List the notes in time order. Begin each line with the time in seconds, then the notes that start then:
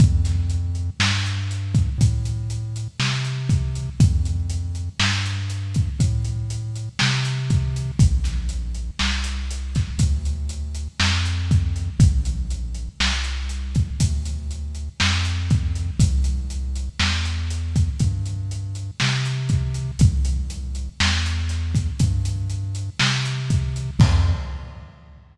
0.00 F2, kick, closed hi-hat
0.25 snare, closed hi-hat
0.50 closed hi-hat
0.75 closed hi-hat
1.00 G2, snare
1.26 closed hi-hat
1.51 closed hi-hat
1.75 kick, closed hi-hat
1.98 A2, kick, closed hi-hat
2.25 closed hi-hat
2.50 closed hi-hat
2.76 closed hi-hat
3.00 C3, snare
3.25 closed hi-hat
3.49 kick, closed hi-hat
3.75 closed hi-hat
4.00 F2, kick, closed hi-hat
4.25 closed hi-hat
4.50 closed hi-hat
4.75 closed hi-hat
5.00 G2, snare
5.26 closed hi-hat
5.50 closed hi-hat
5.74 kick, closed hi-hat
5.99 A2, kick, closed hi-hat
6.25 closed hi-hat
6.50 closed hi-hat
6.75 closed hi-hat
6.99 C3, snare
7.25 closed hi-hat
7.50 kick, closed hi-hat
7.76 closed hi-hat
7.99 A#1, kick, closed hi-hat
8.24 snare, closed hi-hat
8.49 closed hi-hat
8.75 closed hi-hat
8.99 C2, snare
9.24 closed hi-hat
9.51 closed hi-hat
9.75 kick, snare, closed hi-hat
9.98 D2, kick, closed hi-hat
10.25 closed hi-hat
10.49 closed hi-hat
10.75 closed hi-hat
11.00 F2, snare
11.25 closed hi-hat
11.51 kick, closed hi-hat
11.76 closed hi-hat
11.99 A#1, kick, closed hi-hat
12.25 closed hi-hat
12.50 closed hi-hat
12.75 closed hi-hat
13.00 C2, snare
13.24 closed hi-hat
13.49 closed hi-hat
13.75 kick, closed hi-hat
14.00 D2, kick, closed hi-hat
14.25 closed hi-hat
14.51 closed hi-hat
14.75 closed hi-hat
15.00 F2, snare
15.25 closed hi-hat
15.50 kick, closed hi-hat
15.75 closed hi-hat
15.99 C2, kick, closed hi-hat
16.24 closed hi-hat
16.50 closed hi-hat
16.75 closed hi-hat
17.00 E2, snare
17.25 closed hi-hat
17.50 closed hi-hat
17.76 kick, closed hi-hat
18.00 G2, kick, closed hi-hat
18.26 closed hi-hat
18.51 closed hi-hat
18.75 closed hi-hat
19.00 C3, snare
19.25 closed hi-hat
19.49 kick, closed hi-hat
19.74 closed hi-hat
19.99 C2, kick, closed hi-hat
20.25 closed hi-hat
20.50 closed hi-hat
20.75 closed hi-hat
21.00 E2, snare
21.26 closed hi-hat
21.49 snare, closed hi-hat
21.75 kick, closed hi-hat
21.99 G2, kick, closed hi-hat
22.25 closed hi-hat
22.50 closed hi-hat
22.75 closed hi-hat
22.99 C3, snare
23.25 closed hi-hat
23.50 kick, closed hi-hat
23.76 closed hi-hat
23.99 F2, kick, crash